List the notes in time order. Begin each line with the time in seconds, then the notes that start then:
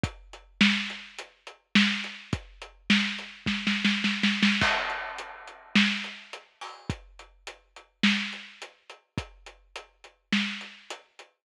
0.03 kick, closed hi-hat
0.33 closed hi-hat
0.61 snare
0.90 closed hi-hat
1.18 closed hi-hat
1.47 closed hi-hat
1.75 snare
2.04 closed hi-hat
2.33 kick, closed hi-hat
2.62 closed hi-hat
2.90 snare
3.19 closed hi-hat
3.46 kick, snare
3.67 snare
3.85 snare
4.04 snare
4.23 snare
4.43 snare
4.61 kick, crash
4.90 closed hi-hat
5.18 closed hi-hat
5.47 closed hi-hat
5.75 snare
6.04 closed hi-hat
6.33 closed hi-hat
6.61 open hi-hat
6.90 kick, closed hi-hat
7.19 closed hi-hat
7.47 closed hi-hat
7.76 closed hi-hat
8.03 snare
8.33 closed hi-hat
8.62 closed hi-hat
8.90 closed hi-hat
9.18 kick, closed hi-hat
9.46 closed hi-hat
9.76 closed hi-hat
10.04 closed hi-hat
10.32 snare
10.61 closed hi-hat
10.90 closed hi-hat
11.19 closed hi-hat